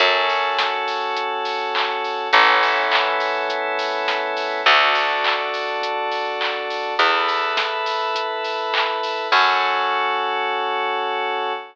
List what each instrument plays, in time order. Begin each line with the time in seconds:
0.00 electric bass (finger) F#2, electric piano 2 C#4 F#4 A4, kick, closed hi-hat
0.29 open hi-hat
0.58 kick, snare
0.88 open hi-hat
1.17 kick, closed hi-hat
1.45 open hi-hat
1.75 kick, clap
2.04 open hi-hat
2.33 electric bass (finger) A1, electric piano 2 B3 C#4 E4 A4, kick, closed hi-hat
2.63 open hi-hat
2.91 kick, clap
3.20 open hi-hat
3.50 kick, closed hi-hat
3.79 open hi-hat
4.08 kick, snare
4.37 open hi-hat
4.66 electric bass (finger) D2, electric piano 2 D4 F#4 A4, kick, closed hi-hat
4.95 open hi-hat
5.24 kick, clap
5.54 open hi-hat
5.82 kick, closed hi-hat
6.12 open hi-hat
6.41 kick, clap
6.70 open hi-hat
6.99 electric bass (finger) E2, electric piano 2 E4 A4 B4, kick, closed hi-hat
7.28 open hi-hat
7.57 kick, snare
7.86 open hi-hat
8.15 kick, closed hi-hat
8.44 open hi-hat
8.74 kick, clap
9.03 open hi-hat
9.32 electric bass (finger) F#2, electric piano 2 C#4 F#4 A4, kick, crash